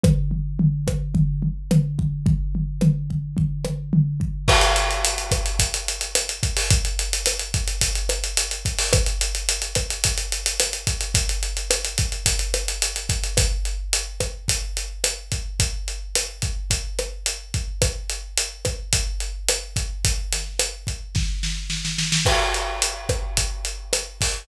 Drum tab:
CC |----------------|----------------|x---------------|----------------|
HH |----------------|----------------|-xxxxxxxxxxxxxxo|xxxxxxxxxxxxxxxo|
SD |r-----r-----r---|----r-----r-----|r-----r-----r---|----r-----r-----|
FT |o-o-o-o-o-o-o-o-|o-o-o-o-o-o-o-o-|----------------|----------------|
BD |o-----o-o-----o-|o-----o-o-----o-|o-----o-o-----o-|o-----o-o-----o-|

CC |----------------|----------------|----------------|----------------|
HH |xxxxxxxxxxxxxxxx|xxxxxxxxxxxxxxxx|x-x-x-x-x-x-x-x-|x-x-x-x-x-x-x-x-|
SD |r-----r-----r---|----r-----r-----|r-----r-----r---|----r-----r-----|
FT |----------------|----------------|----------------|----------------|
BD |o-----o-o-----o-|o-----o-o-----o-|o-----o-o-----o-|o-----o-o-----o-|

CC |----------------|----------------|x---------------|
HH |x-x-x-x-x-x-x-x-|x-x-x-x---------|--x-x-x-x-x-x-o-|
SD |r-----r-----r---|--o-r---o-o-oooo|r-----r-----r---|
FT |----------------|----------------|----------------|
BD |o-----o-o-----o-|o-----o-o-------|o-----o-o-----o-|